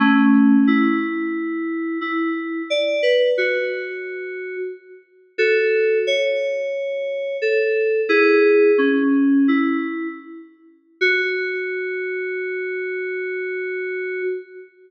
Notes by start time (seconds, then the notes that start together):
0.00 A3 C#4
0.67 E4
2.01 E4
2.70 D5
3.03 B4
3.38 F#4
5.38 F#4 A4
6.07 C#5
7.42 A4
8.09 E4 G#4
8.78 C#4
9.48 E4
11.01 F#4